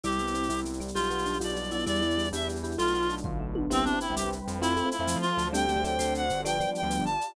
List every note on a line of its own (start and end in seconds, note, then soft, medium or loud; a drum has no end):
0.03 0.46 C2 medium
0.03 0.95 G3 medium
0.03 0.19 G3 loud
0.03 0.95 B3 medium
0.03 0.95 C4 medium
0.03 0.80 E4 medium
0.03 0.95 E4 medium
0.03 0.60 G4 medium
0.03 shaker medium
0.12 shaker medium
0.19 0.34 B3 medium
0.19 shaker medium
0.27 shaker medium
0.34 0.49 C4 medium
0.34 shaker medium
0.43 shaker medium
0.49 0.90 C2 medium
0.49 0.65 E4 medium
0.49 tambourine medium
0.49 shaker medium
0.58 shaker medium
0.65 0.80 G3 medium
0.65 shaker medium
0.73 shaker medium
0.80 1.11 G3 loud
0.80 shaker medium
0.88 shaker medium
0.94 1.36 B1 loud
0.94 1.86 G3 medium
0.94 1.86 B3 medium
0.94 1.86 D4 medium
0.94 1.38 F4 medium
0.94 1.86 F4 medium
0.94 1.57 G4 loud
0.94 shaker medium
1.03 shaker medium
1.10 1.26 B3 medium
1.10 shaker medium
1.18 shaker medium
1.25 1.40 D4 medium
1.25 shaker medium
1.33 shaker medium
1.40 1.82 B1 medium
1.40 1.56 F4 medium
1.40 1.71 D5 medium
1.40 tambourine medium
1.40 shaker medium
1.48 shaker medium
1.56 1.71 G3 medium
1.56 shaker medium
1.64 shaker medium
1.71 1.86 B3 medium
1.71 1.86 E4 medium
1.71 1.84 D5 medium
1.71 shaker medium
1.79 shaker medium
1.86 2.28 E2 medium
1.86 2.01 G3 loud
1.86 2.78 G3 medium
1.86 2.77 B3 medium
1.86 2.77 D4 medium
1.86 2.27 E4 loud
1.86 2.78 E4 medium
1.86 2.29 D5 medium
1.86 shaker medium
1.95 shaker medium
2.02 2.17 E4 medium
2.02 shaker medium
2.10 shaker medium
2.18 2.33 G3 medium
2.18 shaker medium
2.24 shaker medium
2.32 2.74 E2 medium
2.32 2.48 D4 medium
2.32 2.59 G4 medium
2.32 2.48 E5 medium
2.32 tambourine medium
2.32 shaker medium
2.41 shaker medium
2.48 2.63 G3 medium
2.48 shaker medium
2.56 shaker medium
2.63 2.78 E4 medium
2.63 2.76 G4 medium
2.63 shaker medium
2.71 shaker medium
2.78 3.19 B1 loud
2.78 3.68 A3 medium
2.78 2.94 A3 medium
2.78 3.68 B3 medium
2.78 3.68 D4 medium
2.78 3.68 F4 medium
2.78 3.15 F4 loud
2.78 3.08 F4 loud
2.78 shaker medium
2.87 shaker medium
2.94 3.09 B3 medium
2.94 shaker medium
3.02 shaker medium
3.09 3.24 D4 medium
3.09 shaker medium
3.17 shaker medium
3.24 3.66 B1 medium
3.24 3.40 F4 medium
3.24 kick medium
3.24 floor tom medium
3.40 3.55 A3 medium
3.55 3.70 B3 medium
3.55 high tom loud
3.70 3.83 C2 loud
3.70 3.83 B3 loud
3.70 3.97 C4 medium
3.70 3.83 C4 medium
3.70 3.84 C4 loud
3.70 3.83 E4 medium
3.70 3.83 G4 medium
3.70 4.15 B4 medium
3.70 4.15 C5 medium
3.70 4.15 E5 medium
3.70 4.15 G5 medium
3.70 shaker loud
3.84 3.92 B3 medium
3.84 3.92 C4 medium
3.84 3.99 D4 loud
3.84 3.92 E4 medium
3.84 3.92 G4 medium
3.84 shaker medium
3.93 4.05 B3 medium
3.93 4.05 C4 medium
3.93 4.05 E4 medium
3.93 4.05 G4 medium
4.00 4.15 E4 medium
4.00 shaker medium
4.09 4.23 C2 medium
4.09 4.34 B3 medium
4.09 4.34 C4 medium
4.09 4.34 E4 medium
4.09 4.34 G4 medium
4.16 4.59 G3 medium
4.16 4.29 G4 medium
4.16 4.61 B4 loud
4.16 4.60 C5 loud
4.16 4.61 G5 medium
4.16 4.61 B5 medium
4.16 tambourine medium
4.16 shaker loud
4.24 4.38 C2 medium
4.32 shaker medium
4.48 4.77 F2 loud
4.48 shaker medium
4.61 4.74 A3 medium
4.61 4.91 C4 loud
4.61 4.74 C4 medium
4.61 4.89 E4 loud
4.61 4.74 E4 medium
4.61 4.74 F4 medium
4.61 5.06 A4 loud
4.61 5.06 C5 loud
4.61 5.06 E5 loud
4.61 5.06 F5 medium
4.61 shaker loud
4.76 4.83 A3 medium
4.76 4.83 C4 medium
4.76 4.83 E4 medium
4.76 4.83 F4 medium
4.76 shaker medium
4.85 4.97 A3 medium
4.85 4.97 C4 medium
4.85 4.97 E4 medium
4.85 4.97 F4 medium
4.91 5.18 E4 medium
4.91 shaker medium
4.99 5.13 F2 medium
4.99 5.24 A3 medium
4.99 5.24 C4 medium
4.99 5.24 E4 medium
4.99 5.24 F4 medium
5.07 5.47 F3 medium
5.07 5.52 A4 loud
5.07 5.52 C5 loud
5.07 5.52 F5 medium
5.07 5.52 A5 medium
5.07 tambourine medium
5.07 shaker loud
5.16 5.30 F3 medium
5.21 5.48 F4 loud
5.21 shaker medium
5.37 5.95 D2 loud
5.37 shaker medium
5.53 5.65 G3 medium
5.53 5.65 A3 medium
5.53 5.65 C4 medium
5.53 5.65 D4 loud
5.53 5.99 G4 loud
5.53 5.82 G4 loud
5.53 5.98 A4 medium
5.53 5.98 C5 loud
5.53 5.98 D5 medium
5.53 5.83 G5 loud
5.53 shaker loud
5.68 5.75 G3 medium
5.68 5.75 A3 medium
5.68 5.75 C4 medium
5.68 5.75 D4 medium
5.68 shaker medium
5.76 5.84 G3 medium
5.76 5.84 A3 medium
5.76 5.84 C4 medium
5.76 5.84 D4 medium
5.84 6.24 F#3 medium
5.84 6.24 A3 medium
5.84 6.24 C4 loud
5.84 6.24 D4 medium
5.84 6.14 G5 medium
5.84 shaker medium
5.99 6.28 D2 loud
5.99 6.44 F#4 loud
5.99 6.44 A4 medium
5.99 6.44 C5 loud
5.99 6.42 C5 medium
5.99 6.44 D5 medium
5.99 tambourine medium
5.99 shaker loud
6.15 6.41 F#5 medium
6.15 shaker medium
6.30 6.60 G1 loud
6.30 shaker medium
6.45 6.57 F3 loud
6.45 6.57 G3 medium
6.45 6.57 B3 loud
6.45 6.57 D4 medium
6.45 6.89 F4 loud
6.45 6.89 G4 loud
6.45 6.90 B4 loud
6.45 6.82 D5 loud
6.45 6.89 D5 medium
6.45 6.70 G5 loud
6.45 shaker loud
6.60 6.66 F3 medium
6.60 6.66 G3 medium
6.60 6.66 B3 medium
6.60 6.66 D4 medium
6.60 shaker medium
6.67 6.80 F3 medium
6.67 6.80 G3 medium
6.67 6.80 B3 medium
6.67 6.80 D4 medium
6.75 7.04 G5 medium
6.75 shaker medium
6.82 6.97 D2 medium
6.82 7.07 F3 medium
6.82 7.07 G3 medium
6.82 7.07 B3 medium
6.82 7.07 D4 medium
6.90 7.35 F4 medium
6.90 7.35 G4 medium
6.90 7.35 D5 loud
6.90 7.35 F5 loud
6.90 tambourine medium
6.90 shaker medium
6.99 7.13 G1 medium
7.05 7.32 A5 loud
7.05 shaker medium
7.21 shaker medium